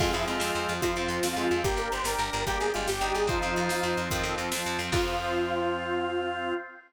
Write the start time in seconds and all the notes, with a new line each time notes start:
0.00 F2 F3 G#3 C4 F4, kick, crash
0.13 F2 F3 C4 E4 G#4, closed hi-hat
0.27 F2 G#3 F4, closed hi-hat
0.40 F2 F3 C4 F4, snare
0.55 F2, closed hi-hat
0.69 F2, closed hi-hat
0.81 F2 F3 C4 F4, kick, closed hi-hat
0.96 F2 F3 C4, closed hi-hat
1.08 F2, closed hi-hat
1.23 F2 F3 C4 F4, snare
1.36 F2 G#3 F4, closed hi-hat
1.50 F2 F3 C4 F4, closed hi-hat
1.63 G1 A#3 D4 G4, kick, closed hi-hat
1.76 G1 A#4, closed hi-hat
1.92 G1 C5, closed hi-hat
2.04 G1 D4 G4 A#4, snare
2.18 G1 D4 A#4, closed hi-hat
2.33 G1, closed hi-hat
2.46 G1 A#3 D4 G4, kick, closed hi-hat
2.60 G1 G#4, closed hi-hat
2.74 G1 G#3 F4, closed hi-hat
2.88 G1 D4 G4, snare
3.01 G1 G3 D#4, closed hi-hat
3.14 G1 G#4, closed hi-hat
3.27 F2 F3 C4 D#4 F4 C5 F5, kick, closed hi-hat
3.42 F2 F3 C4, closed hi-hat
3.56 F2, closed hi-hat
3.69 F2 F3 C4, snare
3.83 F2, closed hi-hat
3.97 F2, closed hi-hat
4.11 F2 D#3 F3 C4, kick, closed hi-hat
4.23 F2 F3 C4, closed hi-hat
4.38 F2, closed hi-hat
4.51 F2 F3 C4, snare
4.66 F2, closed hi-hat
4.79 F2 F3 C4, closed hi-hat
4.92 F2 F3 C4 F4, kick, crash